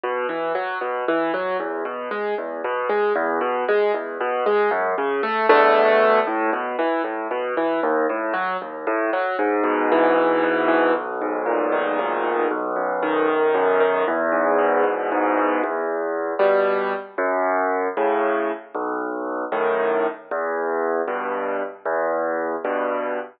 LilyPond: \new Staff { \time 6/8 \key e \major \tempo 4. = 77 b,8 e8 fis8 b,8 e8 fis8 | e,8 b,8 gis8 e,8 b,8 gis8 | e,8 b,8 gis8 e,8 b,8 gis8 | fis,8 cis8 a8 <e, b, d a>4. |
a,8 b,8 e8 a,8 b,8 e8 | dis,8 a,8 fis8 dis,8 a,8 fis8 | gis,8 b,8 e8 gis,8 b,8 e8 | b,,8 gis,8 ais,8 dis8 b,,8 gis,8 |
b,,8 fis,8 dis8 b,,8 fis,8 dis8 | e,8 gis,8 b,8 e,8 gis,8 b,8 | \key e \minor e,4. <b, g>4. | fis,4. <a, cis>4. |
b,,4. <fis, a, dis>4. | e,4. <g, b,>4. | e,4. <g, b,>4. | }